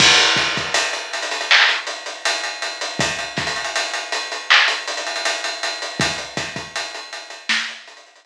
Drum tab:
CC |x-------------------------------|--------------------------------|--------------------------------|
HH |--x-x-x-x-x-xxxx--x-x-x-x-x-x-x-|x-x-xxxxx-x-x-x---x-xxxxx-x-x-x-|x-x-x-x-x-x-x-x---x-xxxxx-------|
CP |----------------x---------------|----------------x---------------|--------------------------------|
SD |--------------------------------|----o---------------------------|----o-----------o---------------|
BD |o---o-o-------------------------|o---o---------------------------|o---o-o-------------------------|